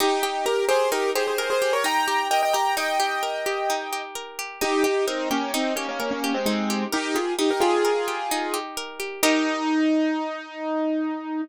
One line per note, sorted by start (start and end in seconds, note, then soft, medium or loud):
0.00 0.91 D#4 loud
0.00 0.22 D#4 medium
0.00 0.22 G4 medium
0.23 0.45 D#4 medium
0.23 0.45 G4 medium
0.23 0.68 G4 medium
0.46 0.65 G4 medium
0.46 0.65 A#4 medium
0.46 1.38 A#4 medium
0.69 1.15 G4 medium
0.69 0.90 G#4 medium
0.69 0.90 C5 medium
0.92 1.84 D#4 medium
0.92 1.11 G4 medium
0.92 1.11 A#4 medium
1.15 1.61 G4 medium
1.15 1.26 G#4 medium
1.15 1.26 C5 medium
1.27 1.38 G#4 medium
1.27 1.38 C5 medium
1.38 1.50 G#4 medium
1.38 2.30 A#4 medium
1.38 1.50 C5 medium
1.50 1.72 G#4 medium
1.50 1.72 C5 medium
1.62 2.07 G4 medium
1.73 1.84 A#4 medium
1.73 1.84 C#5 medium
1.84 2.76 D#4 medium
1.84 2.28 G5 medium
1.84 2.28 A#5 medium
2.08 2.54 G4 medium
2.31 3.22 A#4 medium
2.31 2.42 D#5 medium
2.31 2.42 G5 medium
2.43 2.54 D#5 medium
2.43 2.53 G5 medium
2.53 2.99 G4 medium
2.53 2.75 G5 medium
2.53 2.75 A#5 medium
2.77 3.69 D#4 medium
2.77 4.02 D#5 medium
2.77 4.02 G5 medium
3.00 3.46 G4 medium
3.23 4.15 A#4 medium
3.46 3.92 G4 medium
3.70 4.57 D#4 medium
3.93 4.38 G4 medium
4.15 4.59 A#4 medium
4.39 4.61 G4 medium
4.61 5.53 D#4 medium
4.61 4.83 D#4 medium
4.61 4.83 G4 medium
4.84 5.05 D#4 medium
4.84 5.05 G4 medium
4.84 5.30 G4 medium
5.07 5.29 C4 medium
5.07 5.29 D#4 medium
5.07 5.99 A#4 medium
5.31 5.52 A#3 medium
5.31 5.52 C#4 medium
5.31 5.76 G4 medium
5.54 5.74 C4 medium
5.54 6.46 D#4 medium
5.54 5.74 D#4 medium
5.76 5.87 A#3 medium
5.76 5.87 C#4 medium
5.76 6.23 G4 medium
5.89 5.99 A#3 medium
5.89 5.99 C#4 medium
6.00 6.10 A#3 medium
6.00 6.10 C#4 medium
6.00 6.92 A#4 medium
6.11 6.33 A#3 medium
6.11 6.33 C#4 medium
6.24 6.69 G4 medium
6.34 6.45 G#3 medium
6.34 6.45 C4 medium
6.46 6.84 G#3 medium
6.46 6.84 C4 medium
6.46 7.38 D#4 medium
6.70 7.15 G4 medium
6.92 7.16 D#4 medium
6.92 7.16 G4 medium
6.92 7.84 A#4 medium
7.15 7.34 F4 medium
7.15 7.61 G4 medium
7.15 7.34 G#4 medium
7.39 8.31 D#4 medium
7.39 7.50 D#4 medium
7.39 7.50 G4 medium
7.51 7.62 G4 medium
7.51 7.62 A#4 medium
7.60 8.57 F4 medium
7.60 8.07 G4 medium
7.60 8.57 G#4 medium
7.85 8.77 A#4 medium
8.08 8.53 G4 medium
8.31 9.19 D#4 medium
8.54 8.99 G4 medium
8.77 9.21 A#4 medium
9.00 9.22 G4 medium
9.23 11.41 D#4 loud
9.23 11.42 D#4 loud
9.23 11.42 G4 medium
9.23 11.42 A#4 loud